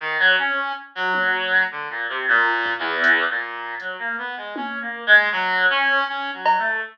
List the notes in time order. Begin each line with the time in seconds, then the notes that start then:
0.00 D#3
0.19 F#3
0.38 C#4
0.95 F#3
1.14 high tom
1.71 D3
1.90 A#2
2.09 C3
2.28 A#2
2.66 kick
2.78 E2
3.04 closed hi-hat
3.29 A#2
3.80 F#3, closed hi-hat
3.99 A#3
4.18 B3
4.37 G#3
4.56 C#4, high tom
4.81 A#3
5.06 G#3
5.32 F#3
5.70 C#4
6.08 C#4
6.33 F#3
6.46 cowbell
6.58 A3